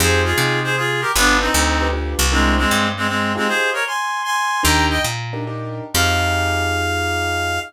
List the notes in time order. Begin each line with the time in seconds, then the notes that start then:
0.00 F2 D#4 F4 G4 G#4 C5
0.25 F4 G#4
0.38 C3 D#4 F4 G4 G#4
0.64 G#4 C5
0.77 F4 G#4
1.01 G4 A#4
1.16 G1 B3 D4 F4 G4 B4
1.41 C4 D#4
1.54 D2
1.80 D4 F4 G4 B4
1.93 D4 F4 G4 B4
2.19 C2
2.32 G#3 C4 D4 E4 A#4 C5
2.58 G#3 C4
2.71 G2
2.97 G#3 C4
3.08 G#3 C4
3.35 G#3 C4 D#4 F4 G4 G#4
3.48 G#4 C5
3.73 A#4 C#5
3.87 G#5 C6
4.24 G#5 C6
4.63 D#2 D4 D#4 G4 A#4 G5 A#5
4.90 D#5 G5
5.04 A#2
5.33 D4 D#4 G4 A#4
5.47 D4 D#4 G4 A#4
5.94 F2 D#4 F4 G4 G#4 F5